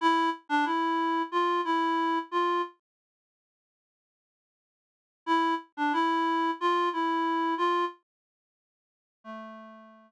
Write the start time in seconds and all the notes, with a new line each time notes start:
0.01 E4
0.49 D4
0.65 E4
1.32 F4
1.65 E4
2.31 F4
5.26 E4
5.77 D4
5.93 E4
6.61 F4
6.93 E4
7.58 F4
9.24 A3